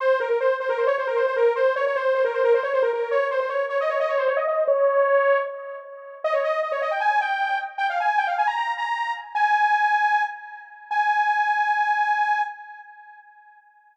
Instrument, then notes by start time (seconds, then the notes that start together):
lead 2 (sawtooth)
0.00 C5
0.20 A#4
0.30 A#4
0.40 C5
0.60 C5
0.69 A#4
0.78 C5
0.87 C#5
0.98 C5
1.07 A#4
1.16 C5
1.27 C5
1.36 A#4
1.56 C5
1.76 C#5
1.87 C#5
1.96 C5
2.15 C5
2.25 A#4
2.34 C5
2.44 A#4
2.54 C5
2.63 C#5
2.73 C5
2.82 A#4
2.93 A#4
3.11 C#5
3.31 C5
3.40 C5
3.49 C#5
3.69 C#5
3.81 D#5
3.90 C#5
4.00 D#5
4.09 C#5
4.18 C5
4.28 C#5
4.37 D#5
4.47 D#5
4.68 C#5
6.24 D#5
6.33 C#5
6.44 D#5
6.62 D#5
6.72 C#5
6.82 D#5
6.91 G5
7.00 G#5
7.21 G5
7.78 G5
7.90 F5
8.00 G#5
8.18 G5
8.27 F5
8.38 G#5
8.47 A#5
8.56 A#5
8.77 A#5
9.35 G#5
10.91 G#5